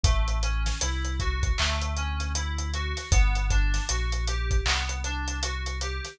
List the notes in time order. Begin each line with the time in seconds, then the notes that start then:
0.04 A1 A3, kick, closed hi-hat
0.28 closed hi-hat
0.43 C#4, closed hi-hat
0.66 snare, closed hi-hat
0.81 C2 E4, closed hi-hat
1.05 closed hi-hat
1.20 F#4, kick, closed hi-hat
1.43 kick, closed hi-hat
1.58 D2 A3, clap
1.82 closed hi-hat
1.97 C#4, closed hi-hat
2.20 closed hi-hat
2.35 E4, closed hi-hat
2.58 closed hi-hat
2.74 F#4, closed hi-hat
2.97 snare, closed hi-hat
3.11 G1 B3, kick, closed hi-hat
3.35 closed hi-hat
3.50 D4, kick, closed hi-hat
3.74 snare, closed hi-hat
3.89 A#1 F#4, closed hi-hat
4.12 closed hi-hat
4.27 G4, closed hi-hat
4.51 kick, closed hi-hat
4.66 C2 B3, clap
4.89 closed hi-hat
5.04 D4, closed hi-hat
5.28 closed hi-hat
5.43 F#4, closed hi-hat
5.66 closed hi-hat
5.81 G4, closed hi-hat
6.05 snare, closed hi-hat